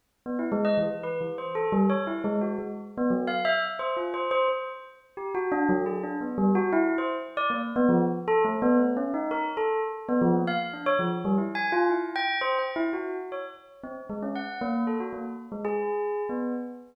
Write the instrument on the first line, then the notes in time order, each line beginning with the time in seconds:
tubular bells
0.26 B3
0.39 E4
0.52 G#3
0.65 D#5
0.77 E3
1.03 B4
1.21 E3
1.38 C5
1.55 A4
1.72 G3
1.90 C#5
2.07 E4
2.24 G#3
2.41 F#4
2.59 G#3
2.98 B3
3.10 F#3
3.27 F5
3.45 E5
3.62 E5
3.79 C5
3.97 F4
4.14 C5
4.31 C5
4.48 C5
5.17 G4
5.35 F#4
5.52 D4
5.69 F#3
5.86 G#4
6.03 D4
6.21 B3
6.38 G3
6.55 F#4
6.73 E4
6.98 C5
7.37 D5
7.50 A#3
7.76 B3
7.89 F3
8.28 A4
8.45 A3
8.62 B3
8.79 A3
8.97 C#4
9.14 D#4
9.31 A#4
9.57 A4
10.09 B3
10.22 F3
10.35 A#3
10.47 F5
10.73 D4
10.86 C#5
10.99 F3
11.25 G3
11.38 E4
11.55 G#5
11.72 F4
11.90 E4
12.16 G5
12.41 C5
12.59 G5
12.76 E4
12.93 F#4
13.32 C#5
13.84 C4
14.09 G#3
14.22 C#4
14.35 F#5
14.61 A#3
14.87 A4
15.00 F#4
15.13 A#3
15.52 G#3
15.65 G#4
16.29 B3